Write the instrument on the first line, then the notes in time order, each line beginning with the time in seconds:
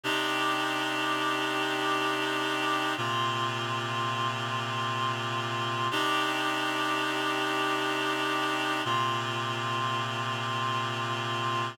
clarinet
0.03 C3 D4 D#4 G4
2.97 A#2 C3 F4
5.91 C3 D4 D#4 G4
8.85 A#2 C3 F4